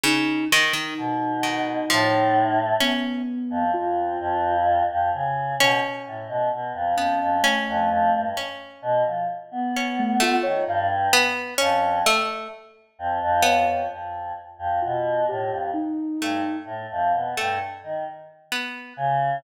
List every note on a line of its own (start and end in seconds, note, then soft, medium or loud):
0.03 0.45 C#3 medium
0.03 0.47 D#4 loud
0.52 0.73 D#3 loud
0.52 2.59 D#4 medium
0.73 0.94 D#3 medium
0.98 1.81 B2 medium
1.43 1.85 D#3 medium
1.90 2.73 A2 loud
1.90 2.73 F3 medium
2.80 3.64 B3 medium
2.80 3.22 C#4 medium
3.50 3.71 F2 medium
3.74 4.17 F2 medium
3.74 4.57 F4 loud
4.20 4.82 F2 loud
4.90 5.11 F2 medium
5.14 5.55 C#3 medium
5.59 5.80 B2 medium
5.59 6.85 C#4 loud
6.06 6.27 A2 medium
6.28 6.49 B2 medium
6.52 6.73 B2 medium
6.74 6.95 F2 medium
6.97 7.18 F2 medium
6.97 7.39 B3 medium
6.97 7.38 C#4 medium
7.21 7.42 F2 medium
7.43 8.26 A3 medium
7.43 8.27 C#4 medium
7.68 7.89 F2 loud
7.90 8.10 F2 loud
8.13 8.34 G2 medium
8.37 9.62 C#4 medium
8.82 9.03 B2 medium
9.05 9.26 F3 medium
9.52 10.35 B3 medium
9.77 10.18 C#4 medium
9.99 10.20 A3 loud
10.20 10.62 A3 loud
10.20 10.43 F4 loud
10.43 10.65 D#3 medium
10.43 10.64 C#5 loud
10.67 11.09 G2 loud
10.67 10.90 F5 loud
11.13 11.55 B3 loud
11.58 12.02 F2 loud
11.58 12.00 C#4 loud
12.06 12.48 A3 loud
12.99 13.19 F2 loud
13.22 13.43 F2 loud
13.43 13.65 F2 medium
13.43 13.84 B3 medium
13.43 13.86 C#5 medium
13.66 13.87 F2 medium
13.91 14.32 F2 soft
14.59 14.79 F2 medium
14.82 15.25 B2 medium
14.82 15.23 F4 medium
15.29 15.50 A2 medium
15.29 15.70 G4 medium
15.50 15.71 F2 medium
15.73 16.57 D#4 medium
16.21 16.42 G2 medium
16.21 16.63 A3 medium
16.65 16.86 A2 medium
16.91 17.12 F2 medium
17.14 17.34 B2 medium
17.37 17.59 G2 medium
17.37 17.58 A3 medium
17.84 18.04 D#3 medium
18.52 18.93 B3 medium
18.97 19.38 C#3 loud